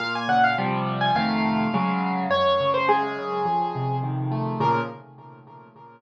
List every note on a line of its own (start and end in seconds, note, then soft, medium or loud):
0.00 0.55 A#2 loud
0.00 0.13 F5 loud
0.15 0.29 G#5 loud
0.28 0.56 C#3 medium
0.28 0.43 F#5 loud
0.44 0.57 F5 loud
0.58 1.10 C3 loud
0.58 1.10 F3 loud
0.58 1.10 G3 loud
1.01 1.15 G#5 medium
1.15 1.67 F2 medium
1.15 1.67 C3 medium
1.15 1.67 D#3 loud
1.15 1.67 A3 loud
1.15 2.15 F5 medium
1.74 2.26 C#3 loud
1.74 2.26 F#3 loud
1.74 2.26 G#3 loud
2.30 3.40 F#2 medium
2.30 2.69 C#5 loud
2.60 3.18 C#3 medium
2.74 2.88 C5 loud
2.88 3.43 G#3 medium
2.88 3.96 G#4 loud
3.19 3.46 C#3 medium
3.45 4.54 F2 medium
3.75 4.57 C3 medium
4.03 4.58 D#3 medium
4.31 4.59 A3 medium
4.60 4.80 A#2 loud
4.60 4.80 C#3 loud
4.60 4.80 F3 medium
4.60 4.81 A#4 loud